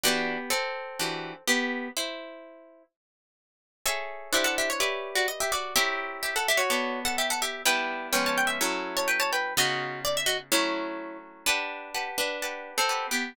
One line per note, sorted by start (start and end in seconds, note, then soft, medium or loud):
0.03 0.37 E3 medium
0.03 0.51 B3 medium
0.03 0.37 D4 medium
0.03 0.37 F#4 medium
0.03 0.51 G4 loud
0.50 1.43 C4 medium
0.50 1.43 A4 loud
0.99 1.33 E3 medium
0.99 1.33 D4 medium
0.99 1.33 F#4 medium
0.99 1.33 G4 medium
1.48 1.88 B3 medium
1.48 1.88 G4 loud
1.97 2.83 E4 medium
1.97 2.83 C5 medium
3.86 4.30 G#4 medium
3.86 4.32 A4 medium
3.86 4.32 C#5 loud
3.86 4.30 E5 loud
3.86 4.32 G#5 medium
4.33 4.79 D4 loud
4.33 4.79 E4 loud
4.33 4.45 G4 medium
4.33 4.79 C5 medium
4.33 4.45 E5 medium
4.33 4.79 F#5 medium
4.44 4.56 A4 loud
4.44 4.56 F#5 loud
4.58 4.69 G4 medium
4.58 4.69 E5 medium
4.70 5.10 C#5 loud
4.80 5.73 G4 medium
4.80 5.73 B4 medium
4.80 5.73 D5 loud
4.80 5.73 E5 loud
5.15 5.27 F#4 medium
5.15 5.27 D5 medium
5.28 5.39 D#5 medium
5.40 5.52 G4 medium
5.40 5.52 E5 loud
5.52 5.74 F#4 medium
5.52 5.74 D5 medium
5.76 6.69 C4 medium
5.76 6.69 E4 medium
5.76 6.21 G4 loud
5.76 6.69 A#4 medium
5.76 6.69 C#5 loud
5.76 6.21 E5 loud
6.23 6.34 G4 medium
6.23 6.34 E5 medium
6.36 6.47 A4 medium
6.36 6.47 F#5 medium
6.48 6.60 G4 medium
6.48 6.60 E5 loud
6.57 7.00 F#4 loud
6.57 7.00 C#5 loud
6.70 7.63 B3 medium
6.70 7.63 A4 medium
6.70 7.63 C#5 medium
6.70 7.63 D5 loud
7.05 7.16 A4 medium
7.05 7.16 F#5 loud
7.18 7.29 G4 medium
7.18 7.29 E5 medium
7.30 7.42 A4 medium
7.30 7.42 F#5 loud
7.42 7.62 G4 medium
7.42 7.62 E5 medium
7.65 8.12 G3 medium
7.65 8.12 B3 medium
7.65 8.12 D4 medium
7.65 8.12 E4 loud
7.65 8.07 B4 medium
7.65 8.07 G5 loud
8.12 8.59 F3 loud
8.12 8.59 G#3 medium
8.12 8.59 B3 medium
8.12 8.59 C#4 loud
8.12 8.24 G5 medium
8.26 8.37 C#5 medium
8.26 8.37 A5 medium
8.38 8.49 G5 loud
8.47 8.87 E5 medium
8.61 9.54 F#3 loud
8.61 9.54 A3 medium
8.61 9.54 C#4 medium
8.61 9.54 E4 medium
8.97 9.08 C#5 medium
8.97 9.08 A5 loud
9.08 9.19 B4 medium
9.08 9.19 G5 medium
9.20 9.31 C#5 medium
9.20 9.31 A5 loud
9.33 9.54 B4 medium
9.33 9.54 G5 medium
9.57 10.50 C#3 medium
9.57 10.50 B3 medium
9.57 10.50 D#4 medium
9.57 10.50 F4 loud
9.57 10.00 F#4 loud
9.57 10.00 D#5 loud
10.05 10.16 D5 loud
10.17 10.28 E5 loud
10.26 10.37 F#4 medium
10.26 10.37 D#5 loud
10.52 11.45 F#3 loud
10.52 11.45 A3 loud
10.52 11.45 C#4 medium
10.52 11.45 E4 loud
10.52 11.17 E4 medium
10.52 11.17 C#5 medium
11.46 12.07 D4 medium
11.46 11.90 G4 medium
11.46 12.07 B4 loud
11.46 11.90 F#5 medium
11.46 11.90 A5 medium
11.94 12.37 G4 medium
11.94 12.37 B4 medium
11.94 12.37 F#5 medium
11.94 12.37 A5 medium
12.18 12.71 D4 medium
12.18 12.71 B4 medium
12.42 12.85 G4 medium
12.42 12.85 B4 medium
12.42 12.85 F#5 medium
12.42 12.85 A5 medium
12.78 13.06 C4 medium
12.78 13.06 A4 medium
12.89 13.32 G4 medium
12.89 13.32 B4 medium
12.89 13.32 F#5 medium
12.89 13.32 A5 medium
13.11 13.33 B3 medium
13.11 13.33 G4 medium